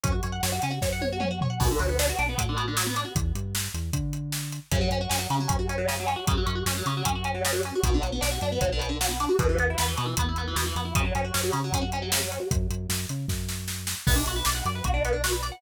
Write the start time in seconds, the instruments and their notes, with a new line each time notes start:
0.03 synth bass 1 F#2, overdriven guitar C#4, kick, closed hi-hat
0.12 overdriven guitar F#4
0.23 synth bass 1 F#2, overdriven guitar C#5, closed hi-hat
0.32 overdriven guitar F#5
0.43 synth bass 1 F#2, overdriven guitar C#5, snare
0.52 overdriven guitar F#4
0.62 synth bass 1 C#3, overdriven guitar C#4, closed hi-hat
0.71 overdriven guitar F#4
0.82 synth bass 1 F#2, overdriven guitar C#5, kick, snare
0.93 overdriven guitar F#5
1.01 overdriven guitar C#5, high tom
1.12 overdriven guitar F#4
1.20 overdriven guitar C#4, mid tom
1.31 overdriven guitar F#4
1.41 overdriven guitar C#5, floor tom
1.50 overdriven guitar F#5
1.60 synth bass 1 B1, overdriven guitar B2, kick, crash
1.71 overdriven guitar D3
1.79 synth bass 1 D2, overdriven guitar F#3, closed hi-hat
1.89 overdriven guitar B3
1.99 overdriven guitar D4, snare
2.09 overdriven guitar F#4
2.19 synth bass 1 B1, overdriven guitar D4, closed hi-hat
2.29 overdriven guitar B3
2.38 synth bass 1 A2, overdriven guitar F#3, kick, closed hi-hat
2.49 overdriven guitar D3
2.57 overdriven guitar B2, closed hi-hat
2.68 overdriven guitar D3
2.77 overdriven guitar F#3, snare
2.86 overdriven guitar B3
2.96 overdriven guitar D4, closed hi-hat
3.05 overdriven guitar F#4
3.15 synth bass 1 E2, kick, closed hi-hat
3.35 synth bass 1 G2, closed hi-hat
3.55 snare
3.74 synth bass 1 E2, closed hi-hat
3.93 synth bass 1 D3, kick, closed hi-hat
4.13 closed hi-hat
4.32 snare
4.52 closed hi-hat
4.71 synth bass 1 F#2, overdriven guitar C#3, kick, closed hi-hat
4.81 overdriven guitar F#3
4.90 synth bass 1 F#2, overdriven guitar C#4, closed hi-hat
5.01 overdriven guitar F#4
5.09 synth bass 1 F#2, overdriven guitar C#4, snare
5.19 overdriven guitar F#3
5.30 synth bass 1 C#3, overdriven guitar C#3, closed hi-hat
5.40 overdriven guitar F#3
5.48 synth bass 1 F#2, overdriven guitar C#4, kick, closed hi-hat
5.59 overdriven guitar F#4
5.69 overdriven guitar C#4, closed hi-hat
5.78 overdriven guitar F#3
5.88 overdriven guitar C#3, snare
6.00 overdriven guitar F#3
6.07 overdriven guitar C#4, closed hi-hat
6.16 overdriven guitar F#4
6.27 synth bass 1 F#2, overdriven guitar C#3, kick, closed hi-hat
6.37 overdriven guitar F#3
6.46 synth bass 1 F#2, overdriven guitar C#4, closed hi-hat
6.55 overdriven guitar F#4
6.66 synth bass 1 F#2, overdriven guitar C#4, snare
6.77 overdriven guitar F#3
6.86 synth bass 1 C#3, overdriven guitar C#3, closed hi-hat
6.97 overdriven guitar F#3
7.05 synth bass 1 F#2, overdriven guitar C#4, kick, closed hi-hat
7.15 overdriven guitar F#4
7.24 overdriven guitar C#4, closed hi-hat
7.34 overdriven guitar F#3
7.45 overdriven guitar C#3, snare
7.53 overdriven guitar F#3
7.63 overdriven guitar C#4, closed hi-hat
7.75 overdriven guitar F#4
7.83 synth bass 1 B1, overdriven guitar B2, kick, closed hi-hat
7.94 overdriven guitar D3
8.02 synth bass 1 B1, overdriven guitar F#3, closed hi-hat
8.12 overdriven guitar B3
8.21 synth bass 1 B1, overdriven guitar D4, snare
8.31 overdriven guitar F#4
8.41 synth bass 1 F#2, overdriven guitar D4, closed hi-hat
8.52 overdriven guitar B3
8.61 synth bass 1 B1, overdriven guitar F#3, kick, closed hi-hat
8.72 overdriven guitar D3
8.79 overdriven guitar B2, closed hi-hat
8.89 overdriven guitar D3
9.01 overdriven guitar F#3, snare
9.09 overdriven guitar B3
9.20 overdriven guitar D4, closed hi-hat
9.29 overdriven guitar F#4
9.39 synth bass 1 E2, overdriven guitar B2, kick, closed hi-hat
9.49 overdriven guitar E3
9.58 synth bass 1 E2, overdriven guitar B3, closed hi-hat
9.70 overdriven guitar E4
9.78 synth bass 1 E2, overdriven guitar B3, snare
9.88 overdriven guitar E3
9.97 overdriven guitar B2, synth bass 1 B2, closed hi-hat
10.06 overdriven guitar E3
10.17 synth bass 1 E2, overdriven guitar B3, kick, closed hi-hat
10.29 overdriven guitar E4
10.36 overdriven guitar B3, closed hi-hat
10.47 overdriven guitar E3
10.56 synth bass 1 E2, overdriven guitar B2, snare
10.66 overdriven guitar E3
10.75 synth bass 1 F2, overdriven guitar B3, closed hi-hat
10.85 overdriven guitar E4
10.95 synth bass 1 F#2, overdriven guitar C#3, kick, closed hi-hat
11.05 overdriven guitar F#3
11.15 synth bass 1 F#2, overdriven guitar C#4, closed hi-hat
11.24 overdriven guitar F#4
11.34 synth bass 1 F#2, overdriven guitar C#4, snare
11.43 overdriven guitar F#3
11.52 overdriven guitar C#3, synth bass 1 C#3, closed hi-hat
11.64 overdriven guitar F#3
11.72 synth bass 1 F#2, overdriven guitar C#4, kick, closed hi-hat
11.81 overdriven guitar F#4
11.92 overdriven guitar C#4, closed hi-hat
12.02 overdriven guitar F#3
12.12 overdriven guitar C#3, snare
12.22 overdriven guitar F#3
12.32 overdriven guitar C#4, closed hi-hat
12.40 overdriven guitar F#4
12.51 synth bass 1 F#2, kick, closed hi-hat
12.70 synth bass 1 F#2, closed hi-hat
12.89 synth bass 1 F#2, snare
13.09 synth bass 1 C#3, closed hi-hat
13.28 synth bass 1 F#2, kick, snare
13.49 snare
13.68 snare
13.87 snare
14.07 synth bass 1 B1, overdriven guitar B3, kick, crash
14.16 overdriven guitar D4
14.26 synth bass 1 B1, overdriven guitar F#4, closed hi-hat
14.36 overdriven guitar B4
14.45 synth bass 1 B1, overdriven guitar D5, snare
14.55 overdriven guitar F#5
14.65 synth bass 1 F#2, overdriven guitar D5, closed hi-hat
14.75 overdriven guitar B4
14.84 synth bass 1 B1, overdriven guitar F#4, kick, closed hi-hat
14.94 overdriven guitar D4
15.05 overdriven guitar B3, closed hi-hat
15.13 overdriven guitar D4
15.24 overdriven guitar F#4, snare
15.32 overdriven guitar B4
15.43 overdriven guitar D5, closed hi-hat
15.52 overdriven guitar F#5